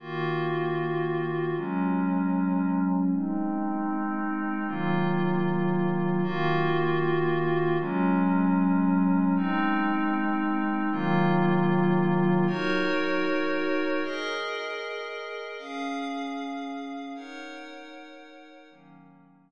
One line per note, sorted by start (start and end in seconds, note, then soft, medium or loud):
0.00 1.53 D#3 medium
0.00 1.53 A#3 medium
0.00 1.53 F4 medium
0.00 1.53 F#4 medium
1.56 3.10 F#3 medium
1.56 3.10 G#3 medium
1.56 3.10 C#4 medium
3.12 4.67 G#3 medium
3.12 4.67 C4 medium
3.12 4.67 D#4 medium
4.67 6.22 D#3 medium
4.67 6.22 F#3 medium
4.67 6.22 A#3 medium
4.67 6.22 F4 medium
6.23 7.77 D#3 medium
6.23 7.77 A#3 medium
6.23 7.77 F4 medium
6.23 7.77 F#4 medium
7.79 9.33 F#3 medium
7.79 9.33 G#3 medium
7.79 9.33 C#4 medium
9.36 10.90 G#3 medium
9.36 10.90 C4 loud
9.36 10.90 D#4 medium
10.91 12.45 D#3 loud
10.91 12.45 F#3 medium
10.91 12.45 A#3 medium
10.91 12.45 F4 medium
12.47 14.01 D#4 medium
12.47 14.01 F#4 medium
12.47 14.01 A#4 medium
12.47 14.01 C#5 medium
14.04 15.58 G#4 medium
14.04 15.58 A#4 medium
14.04 15.58 D#5 medium
15.59 17.13 C#4 medium
15.59 17.13 G#4 medium
15.59 17.13 F5 medium
17.15 18.69 D#4 medium
17.15 18.69 A#4 medium
17.15 18.69 C#5 medium
17.15 18.69 F#5 medium
18.70 19.51 D#3 medium
18.70 19.51 F#3 medium
18.70 19.51 A#3 medium
18.70 19.51 C#4 medium